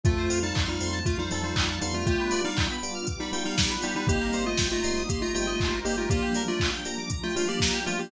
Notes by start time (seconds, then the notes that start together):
0.04 F2 A3 C4 F4 A4, kick, closed hi-hat
0.18 C5
0.30 F2 A3 C4 F4 F5, open hi-hat
0.43 G3 D#4 A5
0.55 F2 C6, kick, clap
0.68 G3 D#4 F6
0.81 F2 A3 C4 F4 C6, open hi-hat
0.93 A5
1.05 F2 F3 A3 F4 F5, kick, closed hi-hat
1.19 G3 D#4 C5
1.31 F2 G3 A3 C4 D#4 F4 A4, open hi-hat
1.44 G3 D#4 C5
1.56 F2 F5, kick, clap
1.69 A5
1.81 F2 G3 B3 D4 D#4 F4 C6, open hi-hat
1.94 A3 F4 F6
2.06 G3 A3 B3 D4 F4 G4, kick, closed hi-hat
2.20 B4
2.31 G3 B3 D4 F4 D5, open hi-hat
2.45 G3 D#4 F5
2.57 G5, kick, clap
2.70 B5
2.82 G3 B3 D4 F4 D6, open hi-hat
2.95 F6
3.07 G3 B3 F4 G4 D6, kick, closed hi-hat
3.20 G3 D#4 B5
3.33 G3 B3 D4 D#4 F4 G5, open hi-hat
3.45 G3 D#4 F5
3.58 D5, kick, snare
3.70 B4
3.82 G3 B3 D4 D#4 F4 G4, open hi-hat
3.95 G3 D#4 B4
4.07 G1 G3 A#3 C4 D#4 G4, kick, closed hi-hat
4.21 A#4
4.33 G1 G3 A#3 C4 D#4 C5, open hi-hat
4.46 A3 F4 D#5
4.57 G1 G5, kick, snare
4.71 A3 F4 A#5
4.84 G1 G3 A#3 C4 D#4 C6, open hi-hat
4.97 D#6
5.09 G1 G3 A#3 D#4 G4 C6, kick, closed hi-hat
5.22 A3 F4 A#5
5.34 G1 G3 A3 A#3 C4 D#4 F4 G5, open hi-hat
5.47 A3 F4 D#5
5.60 G1 C5, kick, clap
5.72 A#4
5.85 G1 G3 A#3 C4 D#4 G4, open hi-hat
5.97 A3 F4 A#4
6.10 F3 G3 A#3 D4 F4 G4, kick, closed hi-hat
6.22 G4
6.35 F3 G3 A#3 D4 A#4, open hi-hat
6.48 A3 F4 D5
6.60 F5, kick, clap
6.73 G5
6.85 F3 G3 A#3 D4 A#5, open hi-hat
6.98 D6
7.10 F3 G3 D4 F4 A#5, kick, closed hi-hat
7.23 A3 F4 G5
7.36 F3 G3 A3 A#3 D4 F4 F5, open hi-hat
7.48 A#3 G4 D5
7.60 A#4, kick, snare
7.74 G4
7.86 F3 G3 A3 A#3 D4 F4, open hi-hat
7.99 A#3 G4